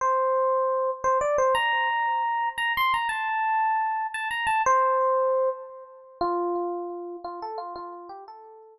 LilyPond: \new Staff { \time 9/8 \key f \major \tempo 4. = 116 c''2. c''8 d''8 c''8 | bes''2. bes''8 c'''8 bes''8 | a''2. a''8 bes''8 a''8 | c''2. r4. |
f'2. f'8 a'8 f'8 | f'4 g'8 a'4. r4. | }